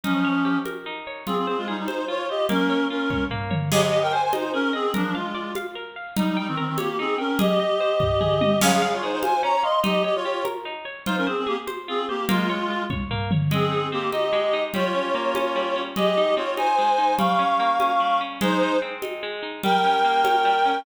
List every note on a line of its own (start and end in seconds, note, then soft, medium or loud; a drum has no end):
0.04 0.58 F3 medium
0.04 0.58 C#4 medium
0.04 0.86 D#4 loud
0.04 low conga medium
0.25 1.07 C#5 medium
0.45 1.23 G4 medium
0.65 1.24 A#4 medium
0.65 high conga medium
0.86 1.25 D#4 medium
1.07 1.26 C#5 medium
1.27 1.36 C4 medium
1.27 2.08 F4 loud
1.27 1.36 G#4 medium
1.27 low conga medium
1.37 1.47 C4 medium
1.37 1.47 G#4 medium
1.47 1.57 C4 medium
1.47 1.57 G#4 medium
1.47 1.87 C5 medium
1.57 1.67 G#3 medium
1.57 1.67 F4 medium
1.68 1.77 G3 medium
1.68 1.77 D#4 medium
1.68 2.45 G#4 medium
1.77 1.87 G3 medium
1.77 1.87 D#4 medium
1.87 2.05 D#4 medium
1.87 2.05 C5 medium
1.87 2.29 C5 medium
1.87 high conga medium
2.08 2.47 F4 loud
2.08 2.26 F4 medium
2.08 2.26 C#5 medium
2.29 2.46 G4 medium
2.29 2.48 C5 medium
2.29 2.46 D#5 medium
2.49 3.30 A#3 loud
2.49 2.86 C#4 medium
2.49 2.86 A#4 medium
2.49 low conga loud
2.70 3.10 C#5 medium
2.90 3.24 C#4 medium
2.90 3.68 F4 medium
2.90 3.24 A#4 medium
3.10 3.50 C#5 medium
3.10 kick medium
3.10 high tom medium
3.31 3.70 A#3 loud
3.31 floor tom medium
3.51 3.70 C#5 medium
3.51 mid tom loud
3.71 3.81 G4 medium
3.71 3.92 G#4 loud
3.71 3.81 D#5 medium
3.71 crash loud
3.71 low conga loud
3.82 3.92 G4 medium
3.82 3.92 D#5 medium
3.92 4.02 G4 medium
3.92 4.12 D#5 medium
3.92 4.02 D#5 medium
4.02 4.12 A#4 medium
4.02 4.12 G5 medium
4.12 4.22 C5 medium
4.12 4.33 C5 medium
4.12 4.22 G#5 medium
4.23 4.32 C5 medium
4.23 4.32 G#5 medium
4.32 4.52 D#4 medium
4.32 4.52 C5 medium
4.32 4.53 D#5 medium
4.32 high conga loud
4.53 4.71 C#4 medium
4.53 4.74 G#4 loud
4.53 4.71 A#4 medium
4.73 4.91 C4 medium
4.73 4.91 G#4 medium
4.73 4.93 D#5 medium
4.94 5.14 F3 medium
4.94 5.14 D4 medium
4.94 5.15 A#4 loud
4.94 low conga loud
5.14 5.52 G#3 medium
5.14 5.52 F4 medium
5.14 5.35 F5 loud
5.34 5.55 D5 loud
5.55 5.77 F5 medium
5.55 high conga medium
5.75 5.96 A#4 medium
5.96 6.16 F5 medium
6.17 6.27 G3 medium
6.17 6.37 D#4 loud
6.17 6.27 D#4 medium
6.17 low conga loud
6.27 6.37 G3 medium
6.27 6.37 D#4 medium
6.37 6.47 G3 medium
6.37 6.47 D#4 medium
6.37 6.57 G5 loud
6.48 6.57 D#3 medium
6.48 6.57 C4 medium
6.57 6.67 D#3 medium
6.57 6.67 C4 medium
6.57 6.78 A#4 loud
6.67 6.77 D#3 medium
6.67 6.77 C4 medium
6.78 6.97 A#3 medium
6.78 6.97 G4 medium
6.78 6.98 C#5 medium
6.78 high conga loud
6.99 7.16 C4 medium
6.99 7.19 D#4 loud
6.99 7.16 G#4 medium
7.18 7.38 C#4 medium
7.18 7.38 A#4 medium
7.18 7.38 G5 loud
7.39 8.59 G4 medium
7.39 7.59 G#4 loud
7.39 8.59 D#5 medium
7.39 low conga loud
7.60 7.80 D#5 loud
7.80 8.01 C5 loud
8.00 8.20 D#5 medium
8.00 kick medium
8.00 floor tom medium
8.21 8.41 G#4 loud
8.21 mid tom medium
8.41 8.61 D#5 medium
8.41 high tom loud
8.61 8.82 C#4 loud
8.61 8.71 G#4 medium
8.61 8.71 F5 medium
8.61 crash loud
8.61 low conga loud
8.72 8.81 G#4 medium
8.72 8.81 F5 medium
8.82 8.91 G#4 medium
8.82 8.91 F5 medium
8.82 9.02 F5 loud
8.93 9.03 F4 medium
8.93 9.03 C#5 medium
9.03 9.11 D#4 medium
9.03 9.23 G#4 medium
9.03 9.11 C5 medium
9.12 9.22 D#4 medium
9.12 9.22 C5 medium
9.23 9.41 C5 medium
9.23 9.43 F5 loud
9.23 9.41 G#5 medium
9.23 high conga loud
9.43 9.63 C#4 loud
9.43 9.63 C#5 medium
9.43 9.63 A#5 medium
9.63 9.80 D#5 medium
9.63 9.83 F5 loud
9.63 9.80 C6 medium
9.84 10.04 D#4 loud
9.84 10.03 G4 medium
9.84 10.03 D#5 medium
9.84 low conga loud
10.04 10.14 G4 medium
10.04 10.24 C#5 loud
10.04 10.14 D#5 medium
10.15 10.43 F4 medium
10.15 10.43 C#5 medium
10.25 10.46 G4 medium
10.45 10.65 A#4 loud
10.45 high conga medium
10.65 10.86 D#4 loud
10.85 11.05 C#5 medium
11.06 11.15 D#4 medium
11.06 11.27 F4 loud
11.06 11.15 C5 medium
11.06 low conga loud
11.17 11.27 C#4 medium
11.17 11.27 A#4 medium
11.27 11.36 C4 medium
11.27 11.36 G#4 medium
11.27 11.47 C5 medium
11.37 11.47 C4 medium
11.37 11.47 G#4 medium
11.47 11.57 A#3 medium
11.47 11.57 G4 medium
11.47 11.67 G#4 medium
11.67 11.88 C5 loud
11.67 high conga medium
11.88 12.05 C4 medium
11.88 12.09 F4 loud
11.88 12.05 G#4 medium
12.09 12.25 A#3 medium
12.09 12.25 G4 medium
12.09 12.28 C5 medium
12.29 12.83 G#3 medium
12.29 12.49 A#3 loud
12.29 12.83 F4 medium
12.29 low conga loud
12.49 12.70 C#5 loud
12.70 12.91 F4 medium
12.90 13.11 C#5 medium
12.90 kick medium
12.90 high tom medium
13.10 13.31 A#3 loud
13.10 floor tom medium
13.31 13.51 C#5 medium
13.31 mid tom loud
13.51 14.32 G#3 loud
13.51 13.87 C4 medium
13.51 13.87 G#4 medium
13.51 low conga loud
13.72 14.12 D#4 medium
13.92 14.09 A#3 medium
13.92 14.70 C4 medium
13.92 14.09 G4 medium
14.12 14.53 D#4 medium
14.12 14.63 G4 medium
14.12 14.63 D#5 medium
14.12 high conga medium
14.33 14.71 G#3 loud
14.53 14.73 D#4 medium
14.74 15.55 G3 loud
14.74 15.82 F4 medium
14.74 15.82 C#5 medium
14.74 low conga loud
14.95 15.35 C#4 medium
15.15 15.92 A#3 loud
15.35 15.75 C#4 medium
15.35 high conga medium
15.56 15.94 G3 loud
15.76 15.95 C#4 medium
15.96 16.78 G#3 loud
15.96 16.34 G4 medium
15.96 16.34 D#5 medium
15.96 low conga loud
16.17 16.57 D#4 medium
16.36 17.14 C4 medium
16.36 16.54 F4 medium
16.36 16.54 C#5 medium
16.57 16.98 D#4 loud
16.57 17.15 C5 medium
16.57 17.15 G#5 medium
16.57 high conga medium
16.78 17.17 G#3 medium
16.98 17.18 D#4 medium
17.18 17.99 G3 loud
17.18 18.19 F5 medium
17.18 18.19 C#6 medium
17.18 low conga loud
17.39 17.79 C#4 medium
17.60 18.37 A#3 medium
17.80 18.20 C#4 medium
17.80 high conga medium
18.00 18.39 G3 medium
18.21 18.40 C#4 medium
18.41 19.22 G#3 loud
18.41 18.77 D#4 loud
18.41 18.77 C5 loud
18.41 low conga loud
18.62 19.02 D#4 medium
18.82 19.59 C4 medium
19.02 19.42 D#4 medium
19.02 high conga medium
19.23 19.62 G#3 loud
19.43 19.62 D#4 medium
19.63 20.44 G3 loud
19.63 20.79 A#4 medium
19.63 20.79 G5 loud
19.63 low conga medium
19.84 20.24 C#4 medium
20.05 20.82 A#3 medium
20.24 20.65 C#4 medium
20.24 high conga loud
20.45 20.84 G3 loud
20.65 20.85 C#4 medium